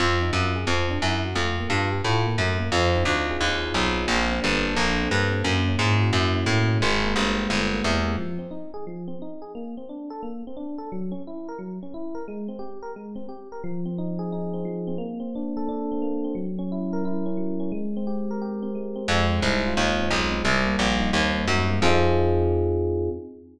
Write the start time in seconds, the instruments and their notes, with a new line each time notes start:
0.00 electric bass (finger) F2, electric piano 1 C4
0.22 electric piano 1 D#4
0.33 electric bass (finger) F#2, electric piano 1 F4
0.56 electric piano 1 G#4
0.67 electric bass (finger) F2, electric piano 1 C4
0.90 electric piano 1 D4
1.02 electric bass (finger) F#2, electric piano 1 E4
1.25 electric piano 1 F#4
1.35 electric bass (finger) F2, electric piano 1 A3
1.60 electric piano 1 A#3
1.69 electric bass (finger) G2, electric piano 1 F4
1.92 electric piano 1 G4
2.04 electric bass (finger) A2, electric piano 1 F4
2.26 electric piano 1 A#3
2.38 electric bass (finger) F#2, electric piano 1 A3
2.59 electric piano 1 A#3
2.72 electric bass (finger) F2, electric piano 1 C4
2.96 electric piano 1 D#4
3.05 electric bass (finger) D2, electric piano 1 F4
3.30 electric piano 1 G#4
3.41 electric bass (finger) D#2, electric piano 1 F4
3.65 electric piano 1 D#4
3.74 electric bass (finger) B1, electric piano 1 C4
3.96 electric piano 1 D#4
4.08 electric bass (finger) A#1, electric piano 1 A#3
4.32 electric piano 1 C4
4.42 electric bass (finger) G1, electric piano 1 D4
4.64 electric piano 1 A4
4.75 electric bass (finger) A#1, electric piano 1 D4
5.02 electric piano 1 C4
5.11 electric bass (finger) G2, electric piano 1 A#3
5.32 electric piano 1 C4
5.44 electric bass (finger) F#2, electric piano 1 A#3
5.68 electric piano 1 C#4
5.79 electric bass (finger) G#2, electric piano 1 E4
6.00 electric piano 1 F#4
6.13 electric bass (finger) F#2, electric piano 1 E4
6.35 electric piano 1 C#4
6.46 electric bass (finger) A2, electric piano 1 A#3
6.68 electric piano 1 C#4
6.81 electric bass (finger) G#1, electric piano 1 G#3
7.04 electric piano 1 A#3
7.16 electric bass (finger) G1, electric piano 1 C4
7.37 electric piano 1 G4
7.50 electric bass (finger) G1, electric piano 1 C4
7.72 electric piano 1 A#3
7.84 electric bass (finger) E2, electric piano 1 G#3
8.04 electric piano 1 A#3
8.18 electric piano 1 F3
8.39 electric piano 1 C4
8.51 electric piano 1 D#4
8.74 electric piano 1 G#4
8.87 electric piano 1 F3
9.08 electric piano 1 C4
9.22 electric piano 1 D#4
9.42 electric piano 1 G#4
9.55 electric piano 1 A#3
9.77 electric piano 1 C4
9.89 electric piano 1 D4
10.10 electric piano 1 A4
10.23 electric piano 1 A#3
10.47 electric piano 1 C4
10.57 electric piano 1 D4
10.78 electric piano 1 A4
10.92 electric piano 1 F#3
11.12 electric piano 1 C#4
11.27 electric piano 1 E4
11.49 electric piano 1 A#4
11.59 electric piano 1 F#3
11.83 electric piano 1 C#4
11.94 electric piano 1 E4
12.15 electric piano 1 A#4
12.28 electric piano 1 G#3
12.48 electric piano 1 C4
12.59 electric piano 1 G4
12.83 electric piano 1 A#4
12.96 electric piano 1 G#3
13.16 electric piano 1 C4
13.29 electric piano 1 G4
13.52 electric piano 1 A#4
13.64 electric piano 1 F3
13.86 electric piano 1 C4
13.98 electric piano 1 D#4
14.19 electric piano 1 G#4
14.32 electric piano 1 D#4
14.54 electric piano 1 C4
14.65 electric piano 1 F3
14.87 electric piano 1 C4
14.98 electric piano 1 A#3
15.20 electric piano 1 C4
15.35 electric piano 1 D4
15.57 electric piano 1 A4
15.69 electric piano 1 D4
15.92 electric piano 1 C4
16.02 electric piano 1 A#3
16.24 electric piano 1 C4
16.35 electric piano 1 F#3
16.59 electric piano 1 C#4
16.72 electric piano 1 E4
16.93 electric piano 1 A#4
17.05 electric piano 1 E4
17.26 electric piano 1 C#4
17.37 electric piano 1 F#3
17.60 electric piano 1 C#4
17.72 electric piano 1 G#3
17.97 electric piano 1 C4
18.07 electric piano 1 G4
18.31 electric piano 1 A#4
18.42 electric piano 1 G4
18.62 electric piano 1 C4
18.75 electric piano 1 G#3
18.96 electric piano 1 C4
19.08 electric bass (finger) F2, electric piano 1 G#3
19.30 electric piano 1 C4
19.42 electric bass (finger) C2, electric piano 1 D#4
19.66 electric piano 1 F4
19.77 electric bass (finger) D#2, electric piano 1 D#4
20.00 electric piano 1 C4
20.11 electric bass (finger) B1, electric piano 1 G#3
20.32 electric piano 1 C4
20.44 electric bass (finger) C2, electric piano 1 G3
20.66 electric piano 1 A#3
20.79 electric bass (finger) A#1, electric piano 1 C4
21.00 electric piano 1 D#4
21.13 electric bass (finger) D#2, electric piano 1 C4
21.36 electric piano 1 A#3
21.47 electric bass (finger) F#2, electric piano 1 G3
21.70 electric piano 1 A#3
21.82 electric bass (finger) F2, electric piano 1 C4 D#4 F4 G#4